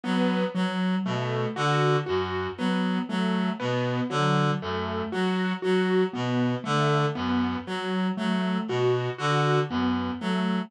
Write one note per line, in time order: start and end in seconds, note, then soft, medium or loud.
0.04 0.44 F#3 medium
0.04 0.45 B3 medium
0.55 0.95 F#3 medium
1.05 1.46 B2 medium
1.05 1.47 A3 medium
1.56 1.97 D3 medium
1.56 1.97 F#4 medium
2.06 2.48 F#2 medium
2.06 2.47 F#4 medium
2.58 2.99 F#3 medium
2.58 2.99 B3 medium
3.09 3.50 F#3 medium
3.09 3.50 A3 medium
3.60 4.00 B2 medium
3.60 4.00 B3 medium
4.10 4.51 D3 medium
4.10 4.51 F#3 medium
4.62 5.02 F#2 medium
4.62 5.03 A3 medium
5.12 5.53 F#3 medium
5.12 5.53 F#4 medium
5.62 6.04 F#3 medium
5.62 6.03 F#4 medium
6.13 6.55 B2 medium
6.13 6.54 B3 medium
6.64 7.06 D3 medium
6.64 7.05 A3 medium
7.15 7.56 F#2 medium
7.15 7.56 B3 medium
7.67 8.08 F#3 medium
8.17 8.58 F#3 medium
8.17 8.58 A3 medium
8.68 9.09 B2 medium
8.68 9.10 F#4 medium
9.18 9.60 D3 medium
9.18 9.59 F#4 medium
9.70 10.10 F#2 medium
9.70 10.11 B3 medium
10.21 10.61 F#3 medium
10.21 10.62 A3 medium